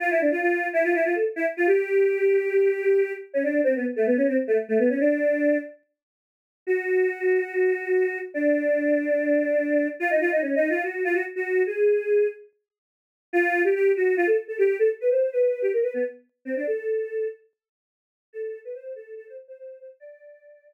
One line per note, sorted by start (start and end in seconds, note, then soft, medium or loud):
0.00 0.10 F4 loud
0.11 0.20 E4 medium
0.21 0.31 D4 medium
0.32 0.41 F4 medium
0.41 0.68 F4 medium
0.73 0.83 E4 medium
0.84 0.94 F4 medium
0.94 1.04 E4 medium
1.05 1.14 F4 medium
1.14 1.24 A4 medium
1.36 1.46 E4 medium
1.57 1.67 F4 medium
1.67 3.12 G4 loud
3.34 3.43 C#4 medium
3.44 3.61 D4 medium
3.64 3.74 C4 loud
3.76 3.86 B3 medium
3.96 4.06 A3 medium
4.07 4.17 B3 medium
4.17 4.27 C#4 medium
4.28 4.37 C4 medium
4.47 4.57 A3 medium
4.68 4.78 A3 medium
4.79 4.89 B3 medium
4.90 4.99 C#4 medium
5.00 5.58 D4 loud
6.67 8.19 F#4 medium
8.34 9.88 D4 medium
10.00 10.10 F4 loud
10.10 10.20 D#4 medium
10.21 10.31 F4 medium
10.31 10.41 D#4 medium
10.42 10.55 C#4 medium
10.56 10.69 D#4 medium
10.70 10.83 F4 medium
10.83 11.03 F#4 medium
11.04 11.14 F4 medium
11.14 11.24 F#4 medium
11.36 11.63 F#4 medium
11.67 12.27 G#4 medium
13.33 13.62 F4 loud
13.64 13.74 G4 medium
13.75 13.92 G4 loud
13.96 14.15 F#4 medium
14.17 14.27 F4 medium
14.27 14.37 A4 loud
14.48 14.58 A4 medium
14.58 14.77 G4 medium
14.79 14.89 A4 loud
15.00 15.10 B4 medium
15.11 15.30 C5 medium
15.32 15.62 B4 loud
15.62 15.72 G4 medium
15.73 15.83 A#4 medium
15.83 15.93 B4 loud
15.94 16.04 B3 medium
16.45 16.55 C4 medium
16.56 16.66 D4 medium
16.67 17.28 A4 loud
18.33 18.59 A4 loud
18.65 18.74 B4 medium
18.75 18.93 C5 medium
18.95 19.14 A4 medium
19.16 19.26 A4 medium
19.27 19.37 C5 medium
19.48 19.58 C5 medium
19.58 19.78 C5 medium
19.80 19.90 C5 medium
20.00 20.73 D5 loud